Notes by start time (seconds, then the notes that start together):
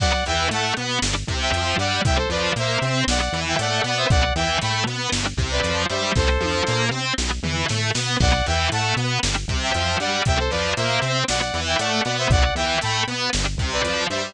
0.00 B1 F#3 B3 D5 F#5, kick, crash
0.26 E2 E3 E5 G5, closed hi-hat
0.51 A2 A3 F#5 A5, closed hi-hat
0.77 B2 B3, closed hi-hat
1.02 G1 G3 D4, snare
1.27 C2 C3, kick, closed hi-hat
1.41 E5 G5
1.52 F2 F3, closed hi-hat
1.78 G2 G3 D5 F#5, closed hi-hat
2.05 C2 G3 C4 E5 G5, kick, closed hi-hat
2.17 A4 C5
2.29 F2 F3 B4 D5, closed hi-hat
2.56 A#2 A#3 C5 E5, closed hi-hat
2.82 C3 C4, closed hi-hat
3.07 B1 F#3 B3 D5 F#5, snare
3.20 D5 F#5
3.32 E2 E3, closed hi-hat
3.47 E5 G5
3.59 A2 A3 D5 F#5, closed hi-hat
3.84 B2 B3 D5 F#5, closed hi-hat
3.97 C5 E5
4.10 B1 F#3 B3 D5 F#5, kick, closed hi-hat
4.35 E2 E3 E5 G5, closed hi-hat
4.61 A2 A3 G5 B5, closed hi-hat
4.86 B2 B3, closed hi-hat
5.12 G1 G3 D4, snare
5.37 C2 C3, kick, closed hi-hat
5.51 B4 D5
5.63 F2 F3, closed hi-hat
5.89 G2 G3 C5 E5, closed hi-hat
6.15 C2 G3 C4 A4 C5, kick, snare
6.40 F2 F3, high tom
6.67 A#2 A#3, snare
6.91 C3 C4
7.18 B1 F#3 B3, snare
7.43 E2 E3, floor tom
7.68 A2 A3, snare
7.95 B2 B3, snare
8.20 B1 F#3 B3 D5 F#5, kick, crash
8.46 E2 E3 E5 G5, closed hi-hat
8.72 A2 A3 F#5 A5, closed hi-hat
8.96 B2 B3, closed hi-hat
9.23 G1 G3 D4, snare
9.48 C2 C3, kick, closed hi-hat
9.62 E5 G5
9.74 F2 F3, closed hi-hat
10.00 G2 G3 D5 F#5, closed hi-hat
10.25 C2 G3 C4 E5 G5, kick, closed hi-hat
10.39 A4 C5
10.51 F2 F3 B4 D5, closed hi-hat
10.76 A#2 A#3 C5 E5, closed hi-hat
11.02 C3 C4, closed hi-hat
11.28 B1 F#3 B3 D5 F#5, snare
11.40 D5 F#5
11.54 E2 E3, closed hi-hat
11.67 E5 G5
11.79 A2 A3 D5 F#5, closed hi-hat
12.04 B2 B3 D5 F#5, closed hi-hat
12.18 C5 E5
12.30 B1 F#3 B3 D5 F#5, kick, closed hi-hat
12.55 E2 E3 E5 G5, closed hi-hat
12.81 A2 A3 G5 B5, closed hi-hat
13.07 B2 B3, closed hi-hat
13.33 G1 G3 D4, snare
13.57 C2 C3, kick, closed hi-hat
13.72 B4 D5
13.84 F2 F3, closed hi-hat
14.10 G2 G3 C5 E5, closed hi-hat